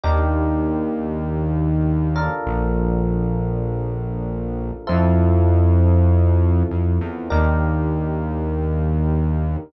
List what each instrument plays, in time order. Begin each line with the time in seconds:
0.04 synth bass 1 D#2, electric piano 1 D4 D#4 G4 A#4
2.16 electric piano 1 D4 F4 A4 A#4
2.47 synth bass 1 A#1
4.87 synth bass 1 F2, electric piano 1 C4 E4 F4 A4
6.71 synth bass 1 F2
7.01 synth bass 1 E2
7.30 synth bass 1 D#2, electric piano 1 D4 D#4 G4 A#4